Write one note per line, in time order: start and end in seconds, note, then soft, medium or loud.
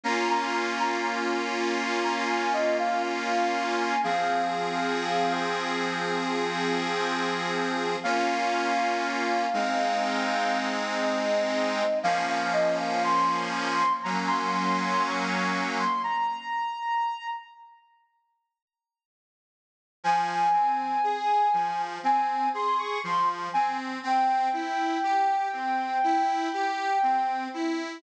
0.04 3.96 A#3 medium
0.04 3.96 C#4 medium
0.04 3.96 F4 medium
0.04 0.28 A#5 medium
0.30 0.54 A#5 medium
0.80 1.03 A#5 medium
2.04 2.27 A#5 medium
2.29 2.53 G#5 medium
2.53 2.77 D#5 medium
2.79 3.03 F5 medium
3.05 3.77 F5 medium
3.78 4.01 G#5 medium
4.04 7.96 F3 medium
4.04 7.96 C4 medium
4.04 7.96 G#4 medium
4.04 5.33 F5 medium
8.03 9.46 A#3 medium
8.03 9.46 C#4 medium
8.03 9.46 F4 medium
8.03 10.59 F5 medium
9.53 11.83 G#3 medium
9.53 11.83 C4 medium
9.53 11.83 D#4 medium
11.03 11.99 D#5 medium
12.03 13.83 F3 medium
12.03 13.83 A#3 medium
12.03 13.83 C#4 medium
12.03 12.27 F5 medium
12.29 12.53 F5 medium
12.53 12.77 D#5 medium
12.80 13.03 F5 medium
13.04 13.93 C6 medium
14.03 15.84 F#3 medium
14.03 15.84 A#3 medium
14.03 15.84 C#4 medium
14.03 14.27 A#5 medium
14.28 14.51 C6 medium
14.53 14.77 C6 medium
14.79 15.03 C6 medium
15.02 15.70 C#6 medium
15.79 16.02 C6 medium
16.04 17.27 A#5 medium
20.04 20.49 F3 medium
20.04 21.82 G#5 medium
20.53 20.98 C4 medium
21.04 21.49 G#4 medium
21.53 21.98 F3 medium
22.03 22.48 C4 medium
22.03 22.49 G#5 medium
22.54 22.99 G#4 medium
22.54 22.79 C6 medium
22.79 23.02 C#6 medium
23.04 23.49 F3 medium
23.04 23.29 C6 medium
23.53 23.99 C4 medium
23.53 23.77 G#5 medium
24.03 24.48 C4 medium
24.03 27.44 G5 medium
24.53 24.98 E4 medium
25.03 25.48 G4 medium
25.53 25.98 C4 medium
26.04 26.49 E4 medium
26.53 26.98 G4 medium
27.03 27.48 C4 medium
27.54 27.99 E4 medium